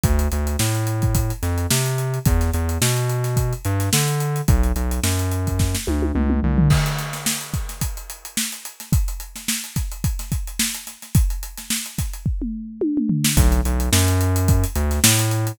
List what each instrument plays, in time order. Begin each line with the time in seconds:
0.03 synth bass 1 D2, kick, closed hi-hat
0.19 closed hi-hat
0.32 synth bass 1 D2, closed hi-hat
0.47 closed hi-hat
0.59 synth bass 1 A2, snare
0.75 closed hi-hat
0.87 closed hi-hat
1.02 kick, closed hi-hat
1.15 kick, closed hi-hat
1.30 closed hi-hat
1.43 synth bass 1 F2, snare, closed hi-hat
1.58 closed hi-hat
1.70 synth bass 1 C3, snare
1.86 closed hi-hat
1.98 closed hi-hat
2.14 closed hi-hat
2.25 synth bass 1 E2, kick, closed hi-hat
2.41 snare, closed hi-hat
2.53 synth bass 1 E2, closed hi-hat
2.69 closed hi-hat
2.81 synth bass 1 B2, snare
2.97 closed hi-hat
3.09 closed hi-hat
3.24 snare, closed hi-hat
3.36 kick, closed hi-hat
3.53 closed hi-hat
3.65 synth bass 1 G2, closed hi-hat
3.80 snare, closed hi-hat
3.93 synth bass 1 D3, snare
4.08 closed hi-hat
4.20 closed hi-hat
4.36 closed hi-hat
4.48 synth bass 1 B1, kick, closed hi-hat
4.63 closed hi-hat
4.76 synth bass 1 B1, closed hi-hat
4.91 closed hi-hat
5.03 synth bass 1 F#2, snare
5.19 closed hi-hat
5.31 closed hi-hat
5.47 kick, closed hi-hat
5.59 kick, snare
5.75 snare
5.87 synth bass 1 D2, high tom
6.02 high tom
6.15 synth bass 1 C#2, mid tom
6.30 mid tom
6.43 synth bass 1 C2, floor tom
6.58 floor tom
6.70 kick, crash
6.86 closed hi-hat
6.98 snare, closed hi-hat
7.13 snare, closed hi-hat
7.26 snare
7.41 closed hi-hat
7.54 kick, snare, closed hi-hat
7.69 snare, closed hi-hat
7.81 kick, closed hi-hat
7.97 closed hi-hat
8.10 closed hi-hat
8.25 closed hi-hat
8.37 snare
8.52 closed hi-hat
8.65 closed hi-hat
8.80 snare, closed hi-hat
8.92 kick, closed hi-hat
9.08 closed hi-hat
9.20 closed hi-hat
9.36 snare, closed hi-hat
9.48 snare
9.64 closed hi-hat
9.76 kick, snare, closed hi-hat
9.92 closed hi-hat
10.04 kick, closed hi-hat
10.19 snare, closed hi-hat
10.32 kick, closed hi-hat
10.47 closed hi-hat
10.59 snare
10.74 closed hi-hat
10.87 snare, closed hi-hat
11.02 snare, closed hi-hat
11.15 kick, closed hi-hat
11.30 closed hi-hat
11.43 closed hi-hat
11.57 snare, closed hi-hat
11.70 snare
11.86 closed hi-hat
11.98 kick, snare, closed hi-hat
12.13 closed hi-hat
12.26 kick
12.42 mid tom
12.81 high tom
12.97 mid tom
13.09 floor tom
13.24 snare
13.37 synth bass 1 B1, kick, closed hi-hat
13.52 closed hi-hat
13.65 synth bass 1 B1, closed hi-hat
13.80 closed hi-hat
13.92 synth bass 1 F#2, snare
14.08 closed hi-hat
14.21 closed hi-hat
14.36 closed hi-hat
14.48 kick, closed hi-hat
14.64 closed hi-hat
14.75 synth bass 1 D2, closed hi-hat
14.91 snare, closed hi-hat
15.04 synth bass 1 A2, snare
15.19 snare, closed hi-hat
15.31 closed hi-hat
15.47 closed hi-hat